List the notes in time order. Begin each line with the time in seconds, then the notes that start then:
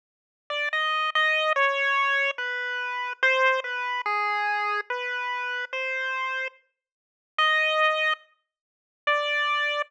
0.50 D5
0.73 D#5
1.15 D#5
1.56 C#5
2.38 B4
3.23 C5
3.64 B4
4.06 G#4
4.90 B4
5.73 C5
7.38 D#5
9.07 D5